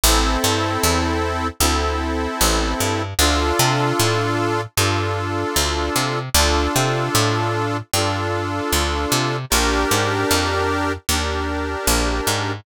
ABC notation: X:1
M:4/4
L:1/8
Q:1/4=76
K:Dm
V:1 name="Accordion"
[CEA]4 [CEA]4 | [DFA]4 [DFA]4 | [DFA]4 [DFA]4 | [DGB]4 [DGB]4 |]
V:2 name="Electric Bass (finger)" clef=bass
A,,, G,, E,,2 D,,2 A,,, G,, | D,, C, A,,2 G,,2 D,, C, | D,, C, A,,2 G,,2 D,, C, | B,,, _A,, F,,2 _E,,2 B,,, A,, |]